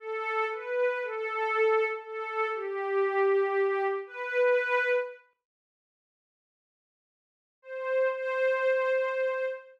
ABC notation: X:1
M:4/4
L:1/8
Q:1/4=59
K:Ador
V:1 name="Pad 5 (bowed)"
A B A2 A G3 | B2 z5 c | c3 z5 |]